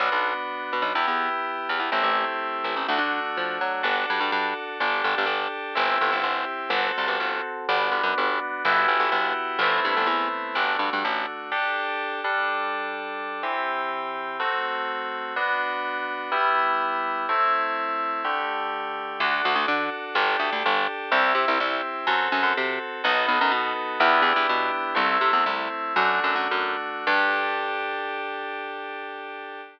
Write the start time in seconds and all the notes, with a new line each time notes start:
0.00 B1 B3 D4 F#4
0.12 B1
0.73 B2
0.82 B1
0.95 E2 B3 E4 G4
1.07 E2
1.69 E2
1.79 E2
1.92 A1 A3 C4 E4 G4
2.03 A1
2.64 A1
2.76 A1
2.88 D2 A3 D4 F#4
2.98 D3
3.37 F3
3.61 F#3
3.83 G1 D4 F#4 A4
4.10 G2
4.20 G2
4.32 G2
4.80 G1 D4 G4 A4
5.04 G1
5.18 G1
5.26 G1
5.75 G1 C4 E4 G4
6.01 G1
6.12 G1
6.23 G1
6.70 G1 C4 F#4 A4
6.98 C2
7.08 G1
7.20 G1
7.69 G1 B3 D4 F#4
7.91 G1
8.03 F#2
8.18 G1
8.65 G1 B3 E4 F#4 G4
8.88 G1
9.00 G1
9.12 G1
9.59 G1 A3 B3 C4 E4
9.85 G2
9.97 G1
10.07 E2
10.55 G1 A3 D4 F#4
10.79 G2
10.93 G2
11.04 A1
11.52 D4 G4 A4
12.24 G3 D4 A4
13.43 E3 C4 G4
14.40 A3 C4 F#4
15.36 B3 D4 F#4
16.32 G3 B3 E4
17.29 A3 C4 E4
18.24 D3 A3 G4
19.20 D2 D4 F#4 A4
19.45 D2
19.55 D2
19.68 D3
20.15 G1 D4 G4 A4
20.39 D2
20.53 D2
20.66 G1
21.11 C2 C4 E4 G4
21.35 C3
21.48 C2
21.60 C2
22.07 F#2 C4 F#4 A4
22.32 F#2
22.43 F#2
22.57 C3
23.04 B1 B3 D#4 F#4 A4
23.28 B1
23.41 F#2
23.52 B2
24.00 E2 B3 D4 E4 G4
24.22 E2
24.36 E2
24.49 B2
24.95 C2 A3 C4 E4
25.21 C3
25.33 E2
25.46 C2
25.96 F#2 A3 D4 F#4
26.24 F#2
26.35 F#2
26.51 F#2
27.07 G2 D4 G4 A4